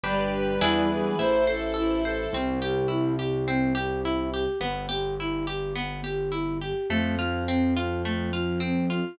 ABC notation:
X:1
M:4/4
L:1/8
Q:1/4=105
K:C
V:1 name="Violin"
d B E ^G c A E A | z8 | z8 | z8 |]
V:2 name="Flute"
G,4 z4 | C G E G C G E G | B, G E G B, G E G | A, F C F A, F C F |]
V:3 name="Orchestral Harp"
[DGB]2 [DE^GB]2 E c A c | C G E G C G E G | B, G E G B, G E G | A, F C F A, F C F |]
V:4 name="Acoustic Grand Piano" clef=bass
G,,,2 E,,2 A,,,4 | C,,8 | G,,,8 | F,,8 |]
V:5 name="String Ensemble 1"
[DGB]2 [DE^GB]2 [EAc]4 | z8 | z8 | z8 |]